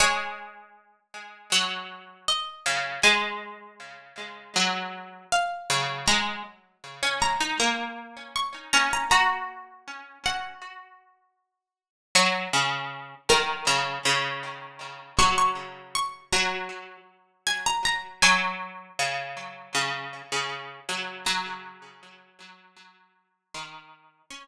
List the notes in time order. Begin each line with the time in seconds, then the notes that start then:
0.00 G#3 C#5
1.52 F#3
2.28 D#5
2.66 C#3
3.03 G#3 G#5
4.56 F#3
5.32 F5
5.70 C#3
6.08 G#3 A#5
7.03 C#4
7.22 A#5
7.41 D#4
7.60 A#3 A#5
8.36 C#6
8.73 C#4 A#5
8.93 A#5
9.11 F#4 A#5
10.26 F#5
12.15 F#3 C#5
12.53 C#3
13.29 D#3 A#4
13.67 C#3 A#5
14.05 C#3
15.19 F#3 C#6
15.38 C#6
15.95 C#6
16.32 F#3 A#5
17.47 G#5
17.66 A#5
17.85 A#5
18.22 F#3 G#5
18.99 C#3
19.75 C#3
20.32 C#3
20.89 F#3
21.26 F#3 A#5
23.54 D#3 C6
24.30 C#4 C#6